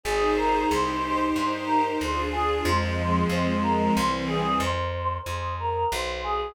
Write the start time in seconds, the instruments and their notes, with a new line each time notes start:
0.04 electric bass (finger) G#1, string ensemble 1 D#4 G#4 C5, choir aahs G#4
0.36 choir aahs A#4
0.69 electric bass (finger) C2, string ensemble 1 D#4 G4 C5, choir aahs C5
1.35 electric bass (finger) G2, choir aahs C5
1.66 choir aahs A#4
1.99 electric bass (finger) D2, string ensemble 1 D4 F4 G#4, choir aahs C5
2.32 choir aahs G#4
2.65 electric bass (finger) F2, string ensemble 1 F3 G#3 C4, choir aahs C5
3.29 electric bass (finger) F2, choir aahs C5
3.63 choir aahs A#4
3.96 electric bass (finger) C2, string ensemble 1 E3 G3 C4, choir aahs C5
4.27 choir aahs G#4
4.60 electric bass (finger) F2, choir aahs C5
5.25 electric bass (finger) F2, choir aahs C5
5.59 choir aahs A#4
5.92 electric bass (finger) B1, choir aahs C5
6.23 choir aahs G#4